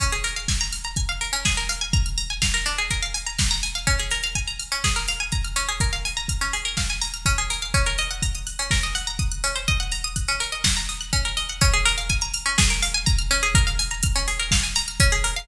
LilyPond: <<
  \new Staff \with { instrumentName = "Pizzicato Strings" } { \time 4/4 \key des \major \tempo 4 = 124 des'16 aes'16 bes'16 f''16 aes''16 bes''16 f'''16 bes''16 aes''16 f''16 bes'16 des'16 aes'16 bes'16 f''16 aes''16 | bes''16 f'''16 bes''16 aes''16 f''16 bes'16 d'16 aes'16 bes'16 f''16 aes''16 bes''16 f'''16 bes''16 aes''16 f''16 | des'16 aes'16 bes'16 f''16 aes''16 bes''16 f'''16 des'16 aes'16 bes'16 f''16 aes''16 bes''16 f'''16 des'16 aes'16 | bes'16 f''16 aes''16 bes''16 f'''16 des'16 aes'16 bes'16 f''16 aes''16 bes''16 f'''16 des'16 aes'16 bes'16 f''16 |
des'16 bes'16 ees''16 ges''16 bes''16 ees'''16 ges'''16 des'16 bes'16 ees''16 ges''16 bes''16 ees'''16 ges'''16 des'16 c''16 | ees''16 ges''16 bes''16 ees'''16 ges'''16 des'16 bes'16 ees''16 ges''16 bes''16 ees'''16 ges'''16 des'16 bes'16 ees''16 ges''16 | des'16 aes'16 bes'16 f''16 aes''16 bes''16 f'''16 des'16 aes'16 bes'16 f''16 aes''16 bes''16 f'''16 des'16 aes'16 | bes'16 f''16 aes''16 bes''16 f'''16 des'16 aes'16 bes'16 f''16 aes''16 bes''16 f'''16 des'16 aes'16 bes'16 f''16 | }
  \new DrumStaff \with { instrumentName = "Drums" } \drummode { \time 4/4 <hh bd>16 hh16 hho16 hh16 <bd sn>16 hh16 hho16 hh16 <hh bd>16 hh16 hho16 hh16 <bd sn>16 hh16 hho16 hh16 | <hh bd>16 hh16 hho16 hh16 <bd sn>16 hh16 hho16 hh16 <hh bd>16 hh16 hho16 hh16 <bd sn>16 hh16 hho16 hh16 | <hh bd>16 hh16 hho16 hh16 <hh bd>16 hh16 hho16 hh16 <bd sn>16 hh16 hho16 hh16 <hh bd>16 hh16 hho16 hh16 | <hh bd>16 hh16 hho16 hh16 <hh bd>16 hh16 hho16 hh16 <bd sn>16 hh16 hho16 hh16 <hh bd>16 hh16 hho16 hh16 |
<hh bd>16 hh16 hho16 hh16 <hh bd>16 hh16 hho16 hh16 <bd sn>16 hh16 hho16 hh16 <hh bd>16 hh16 hho16 hh16 | <hh bd>16 hh16 hho16 hh16 <hh bd>16 hh16 hho16 hh16 <bd sn>16 hh16 hho16 hh16 <hh bd>16 hh16 hho16 hh16 | <hh bd>16 hh16 hho16 hh16 <hh bd>16 hh16 hho16 hh16 <bd sn>16 hh16 hho16 hh16 <hh bd>16 hh16 hho16 hh16 | <hh bd>16 hh16 hho16 hh16 <hh bd>16 hh16 hho16 hh16 <bd sn>16 hh16 hho16 hh16 <hh bd>16 hh16 hho16 hh16 | }
>>